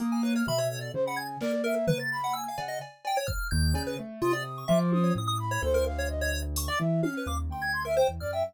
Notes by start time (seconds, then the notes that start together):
0.00 A#3 D#6, closed hi-hat
0.12 G#5
0.23 B4 C#5
0.35 C#5 F6
0.47 B2 E5 B5, floor tom
0.58 C#5
0.70 A4
0.81 D5
0.94 C#3 C5
1.05 F#5 B5
1.16 G#5 G#6
1.41 A#3 A#4 D5, clap
1.64 A#4 E5
1.88 B4, floor tom
1.99 A6
2.12 B5
2.24 F#5
2.33 G#5 E6
2.48 F5
2.58 C#3 F#5, cowbell
2.68 D#5
2.81 cowbell
3.05 G5, cowbell
3.17 C#5
3.27 F6, kick
3.51 D#2 G6
3.74 C#3, cowbell
3.87 B4
3.99 A3
4.22 C3 F4 D#6
4.33 D5
4.58 C#6
4.68 F3 E5 D6
4.92 D#6, high tom
5.04 C#5
5.15 A2 D#6
5.27 D#6
5.39 B5
5.51 C#5
5.62 D2 A4 C5
5.74 A#4
5.86 F5
5.98 C#5
6.09 D#5
6.21 C#5
6.56 C#6, closed hi-hat
6.68 D5 D6
6.79 E3 E5
7.02 C#4 F5 F6, high tom
7.17 B4
7.26 D#2 F5 D6
7.50 D2 G5 C6
7.62 G#6
7.73 C6
7.85 A#4 E5
7.97 C5 G5
8.09 E2
8.20 F#2 D5 F6
8.33 E5 G5